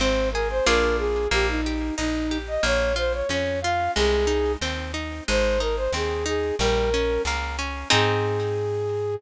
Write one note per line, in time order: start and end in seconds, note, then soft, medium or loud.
0.00 0.61 G#1 medium
0.00 0.30 C4 medium
0.00 0.29 C5 loud
0.32 0.65 G#4 medium
0.32 0.48 A#4 medium
0.50 0.66 C5 loud
0.66 1.28 A#1 medium
0.66 1.26 A#3 medium
0.66 1.26 D4 medium
0.66 1.26 F4 medium
0.66 1.26 G#4 medium
0.66 0.97 A#4 loud
0.98 1.28 G#4 loud
1.31 1.91 A#1 medium
1.31 1.61 A#3 medium
1.31 1.47 G4 loud
1.49 1.95 D#4 medium
1.66 1.96 G4 medium
1.97 2.58 A#1 medium
1.97 2.38 D#4 loud
1.97 2.27 D#4 medium
2.31 2.61 G4 medium
2.48 2.64 D#5 loud
2.63 3.23 A#1 medium
2.63 2.93 A#3 medium
2.63 2.95 C#5 loud
2.96 3.26 F4 medium
2.96 3.13 C5 loud
3.13 3.29 C#5 medium
3.29 3.89 F2 medium
3.29 3.60 C#4 medium
3.29 3.60 C#5 loud
3.62 3.94 F4 medium
3.62 3.91 F5 loud
3.96 4.56 C2 loud
3.96 4.26 G#3 medium
3.96 4.52 G#4 loud
4.27 4.57 D#4 medium
4.61 5.21 D#2 medium
4.61 4.92 C4 medium
4.94 5.23 D#4 medium
5.28 5.88 G#1 medium
5.28 5.58 G#3 medium
5.28 5.60 C5 loud
5.60 5.90 D#4 medium
5.60 5.76 A#4 medium
5.77 5.92 C5 loud
5.93 6.52 D#2 medium
5.93 6.24 C4 medium
5.93 6.25 G#4 medium
6.26 6.55 D#4 medium
6.26 6.56 G#4 loud
6.59 7.19 A#1 medium
6.59 6.90 G3 medium
6.59 7.22 A#4 loud
6.94 7.23 C#4 medium
7.25 7.84 C#2 medium
7.25 7.57 A#3 medium
7.59 7.88 C#4 medium
7.90 9.16 G#2 loud
7.90 9.14 C4 loud
7.90 9.14 D#4 loud
7.90 9.14 G#4 loud
7.90 9.15 G#4 loud